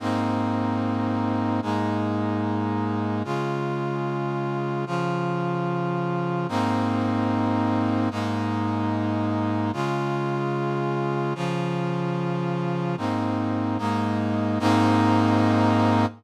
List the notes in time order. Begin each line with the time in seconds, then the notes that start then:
0.00 G#2 A#3 C4 D#4
1.62 G#2 G#3 A#3 D#4
3.24 C#3 G#3 F4
4.86 C#3 F3 F4
6.49 G#2 A#3 C4 D#4
8.11 G#2 G#3 A#3 D#4
9.73 C#3 G#3 F4
11.35 C#3 F3 F4
12.97 G#2 A#3 C4 D#4
13.78 G#2 G#3 A#3 D#4
14.59 G#2 A#3 C4 D#4